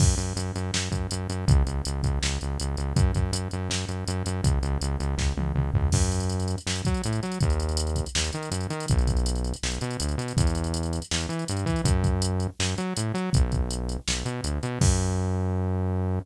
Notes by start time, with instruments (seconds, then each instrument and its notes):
0.00 synth bass 1 F#2, kick, crash
0.18 synth bass 1 F#2, closed hi-hat
0.36 synth bass 1 F#2, closed hi-hat
0.56 synth bass 1 F#2, closed hi-hat
0.74 synth bass 1 F#2, snare
0.92 synth bass 1 F#2, kick, closed hi-hat
1.11 synth bass 1 F#2, closed hi-hat
1.30 synth bass 1 F#2, closed hi-hat
1.48 synth bass 1 C#2, kick, closed hi-hat
1.66 synth bass 1 C#2, closed hi-hat
1.85 synth bass 1 C#2, closed hi-hat
2.03 synth bass 1 C#2, kick, closed hi-hat
2.22 synth bass 1 C#2, snare
2.41 synth bass 1 C#2, closed hi-hat
2.60 synth bass 1 C#2, closed hi-hat
2.77 synth bass 1 C#2, closed hi-hat
2.96 synth bass 1 F#2, kick, closed hi-hat
3.15 synth bass 1 F#2, kick, closed hi-hat
3.32 synth bass 1 F#2, closed hi-hat
3.51 synth bass 1 F#2, closed hi-hat
3.69 synth bass 1 F#2, snare
3.89 synth bass 1 F#2, closed hi-hat
4.08 synth bass 1 F#2, closed hi-hat
4.26 synth bass 1 F#2, closed hi-hat
4.44 synth bass 1 C#2, kick, closed hi-hat
4.62 synth bass 1 C#2, closed hi-hat
4.81 synth bass 1 C#2, closed hi-hat
5.00 synth bass 1 C#2, closed hi-hat
5.18 synth bass 1 C#2, kick, snare
5.37 synth bass 1 C#2, high tom
5.55 synth bass 1 C#2, mid tom
5.74 synth bass 1 C#2, floor tom
5.92 synth bass 1 F#2, kick, crash
6.02 closed hi-hat
6.12 closed hi-hat
6.20 closed hi-hat
6.30 closed hi-hat
6.40 closed hi-hat
6.48 closed hi-hat
6.58 closed hi-hat
6.66 synth bass 1 F#2, snare
6.76 closed hi-hat
6.85 synth bass 1 F#3, kick, closed hi-hat
6.94 closed hi-hat
7.04 synth bass 1 A2, closed hi-hat
7.13 closed hi-hat
7.23 synth bass 1 F#3, closed hi-hat
7.32 closed hi-hat
7.41 synth bass 1 D#2, kick, closed hi-hat
7.50 closed hi-hat
7.60 closed hi-hat
7.69 closed hi-hat
7.77 closed hi-hat
7.87 closed hi-hat
7.96 kick, closed hi-hat
8.06 closed hi-hat
8.15 synth bass 1 D#2, snare
8.24 closed hi-hat
8.33 synth bass 1 D#3, closed hi-hat
8.43 closed hi-hat
8.51 synth bass 1 F#2, closed hi-hat
8.61 closed hi-hat
8.70 synth bass 1 D#3, closed hi-hat
8.80 closed hi-hat
8.88 synth bass 1 B1, kick, closed hi-hat
8.99 closed hi-hat
9.07 kick, closed hi-hat
9.17 closed hi-hat
9.26 closed hi-hat
9.35 closed hi-hat
9.44 closed hi-hat
9.54 closed hi-hat
9.63 synth bass 1 B1, snare
9.72 closed hi-hat
9.81 synth bass 1 B2, closed hi-hat
9.91 closed hi-hat
10.00 synth bass 1 D2, closed hi-hat
10.09 closed hi-hat
10.18 synth bass 1 B2, closed hi-hat
10.28 closed hi-hat
10.37 synth bass 1 E2, kick, closed hi-hat
10.47 closed hi-hat
10.55 closed hi-hat
10.64 closed hi-hat
10.74 closed hi-hat
10.83 closed hi-hat
10.93 closed hi-hat
11.02 closed hi-hat
11.11 synth bass 1 E2, snare
11.21 closed hi-hat
11.29 synth bass 1 E3, closed hi-hat
11.39 closed hi-hat
11.48 synth bass 1 G2, closed hi-hat
11.57 closed hi-hat
11.66 synth bass 1 E3, kick, closed hi-hat
11.76 closed hi-hat
11.84 synth bass 1 F#2, kick, closed hi-hat
12.04 kick, closed hi-hat
12.22 closed hi-hat
12.40 closed hi-hat
12.59 synth bass 1 F#2, snare
12.78 synth bass 1 F#3, closed hi-hat
12.97 synth bass 1 A2, closed hi-hat
13.14 synth bass 1 F#3, closed hi-hat
13.33 synth bass 1 B1, kick, closed hi-hat
13.52 kick, closed hi-hat
13.71 closed hi-hat
13.89 closed hi-hat
14.08 synth bass 1 B1, snare
14.25 synth bass 1 B2, closed hi-hat
14.44 synth bass 1 D2, closed hi-hat
14.63 synth bass 1 B2, closed hi-hat
14.81 synth bass 1 F#2, kick, crash